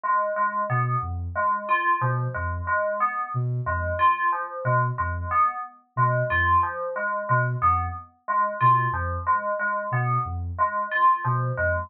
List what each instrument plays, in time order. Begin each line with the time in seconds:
0.04 tubular bells G#3
0.36 tubular bells G#3
0.70 ocarina B2, tubular bells B3
1.02 ocarina F2
1.36 tubular bells G#3
1.69 tubular bells F4
2.01 ocarina B2, tubular bells F3
2.34 ocarina F2, tubular bells G#3
2.67 tubular bells G#3
3.00 tubular bells B3
3.34 ocarina B2
3.66 ocarina F2, tubular bells G#3
3.99 tubular bells F4
4.32 tubular bells F3
4.65 ocarina B2, tubular bells G#3
4.98 ocarina F2, tubular bells G#3
5.31 tubular bells B3
5.96 ocarina B2, tubular bells G#3
6.30 ocarina F2, tubular bells F4
6.63 tubular bells F3
6.96 tubular bells G#3
7.29 ocarina B2, tubular bells G#3
7.62 ocarina F2, tubular bells B3
8.28 tubular bells G#3
8.61 ocarina B2, tubular bells F4
8.92 ocarina F2, tubular bells F3
9.27 tubular bells G#3
9.59 tubular bells G#3
9.91 ocarina B2, tubular bells B3
10.25 ocarina F2
10.59 tubular bells G#3
10.91 tubular bells F4
11.25 ocarina B2, tubular bells F3
11.58 ocarina F2, tubular bells G#3